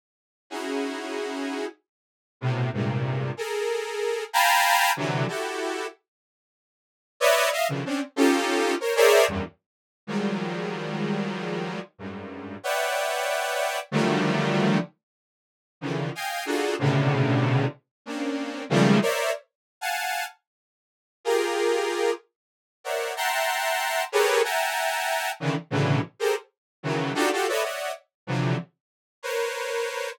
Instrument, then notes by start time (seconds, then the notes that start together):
lead 2 (sawtooth)
0.50 C#4 D#4 E4 F#4 G#4
2.41 A2 B2 C3
2.73 G2 G#2 A#2 C3
3.37 G#4 A4 A#4
4.33 F5 G5 G#5 A5 A#5 B5
4.96 C3 D3 E3 F#3
5.28 E4 F#4 G4 A4
7.20 B4 C#5 D5 D#5 E5
7.52 D#5 E5 F5
7.68 B2 C#3 D3 D#3 E3 F3
7.85 C4 C#4 D4
8.16 C#4 D#4 F4 G4 A4
8.80 A#4 C5 C#5
8.96 G#4 A#4 C5 C#5 D5 E5
9.28 E2 F#2 G2
10.07 D#3 F3 F#3 G3 G#3
11.98 F#2 G2 G#2
12.63 B4 C#5 D5 E5 F#5 G5
13.91 D3 D#3 F3 F#3 G3 A3
15.81 C#3 D3 D#3 E3 F3
16.15 D#5 F5 G5 G#5
16.45 D4 D#4 F4 F#4 G#4 A4
16.79 A2 B2 C3 C#3 D3
18.06 A#3 C4 C#4 D4
18.70 C#3 D#3 F3 G3 G#3 A3
19.02 A#4 C5 C#5 D5 E5
19.81 F5 F#5 G#5 A5
21.24 F4 G4 G#4 A#4
22.84 A#4 C5 C#5 D5 E5 F#5
23.16 E5 F#5 G5 A5 A#5 C6
24.12 G4 G#4 A4 A#4 B4 C#5
24.44 E5 F#5 G5 G#5 A5 A#5
25.40 C#3 D3 D#3 E3
25.70 A2 B2 C#3 D3 E3 F#3
26.19 G4 G#4 A4 A#4 C5
26.83 C#3 D#3 E3 F#3
27.14 D4 D#4 F4 F#4 G4 A4
27.32 F4 F#4 G4 A4
27.48 A4 B4 C#5 D5 D#5 E5
27.62 C#5 D5 D#5 E5 F#5
28.27 C3 D3 E3 F3 F#3
29.23 A#4 B4 C5 C#5